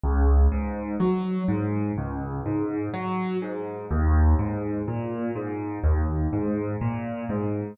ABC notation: X:1
M:4/4
L:1/8
Q:1/4=62
K:Ab
V:1 name="Acoustic Grand Piano" clef=bass
D,, A,, _G, A,, D,, A,, G, A,, | E,, A,, B,, A,, E,, A,, B,, A,, |]